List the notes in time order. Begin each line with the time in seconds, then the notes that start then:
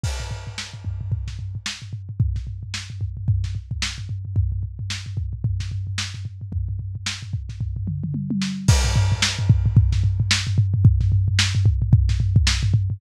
0.03 kick, crash
0.20 snare, floor tom
0.31 floor tom
0.47 floor tom
0.58 snare
0.74 floor tom
0.84 kick, floor tom
1.01 floor tom
1.12 kick, floor tom
1.27 snare, floor tom
1.39 floor tom
1.55 floor tom
1.66 snare
1.82 floor tom
1.93 floor tom
2.09 floor tom
2.20 kick, floor tom
2.36 snare, floor tom
2.47 floor tom
2.63 floor tom
2.74 snare
2.90 floor tom
3.01 kick, floor tom
3.17 floor tom
3.28 kick, floor tom
3.44 snare, floor tom
3.55 floor tom
3.71 kick, floor tom
3.82 snare
3.98 floor tom
4.09 floor tom
4.25 floor tom
4.36 kick, floor tom
4.52 floor tom
4.63 floor tom
4.79 floor tom
4.90 snare
5.06 floor tom
5.17 kick, floor tom
5.33 floor tom
5.44 kick, floor tom
5.60 snare, floor tom
5.72 floor tom
5.87 floor tom
5.98 snare
6.14 snare, floor tom
6.25 floor tom
6.41 floor tom
6.52 kick, floor tom
6.69 floor tom
6.79 floor tom
6.95 floor tom
7.06 snare
7.22 floor tom
7.33 kick, floor tom
7.49 snare, floor tom
7.61 kick, floor tom
7.76 floor tom
7.87 mid tom
8.03 mid tom
8.14 high tom
8.31 high tom
8.42 snare
8.68 kick, crash
8.84 snare, floor tom
8.96 floor tom
9.12 floor tom
9.22 snare
9.39 floor tom
9.50 kick, floor tom
9.66 floor tom
9.77 kick, floor tom
9.92 snare, floor tom
10.04 floor tom
10.20 floor tom
10.31 snare
10.47 floor tom
10.58 floor tom
10.74 floor tom
10.85 kick, floor tom
11.01 snare, floor tom
11.12 floor tom
11.28 floor tom
11.39 snare
11.55 floor tom
11.66 kick, floor tom
11.82 floor tom
11.93 kick, floor tom
12.09 snare, floor tom
12.20 floor tom
12.36 kick, floor tom
12.47 snare
12.63 floor tom
12.74 floor tom
12.90 floor tom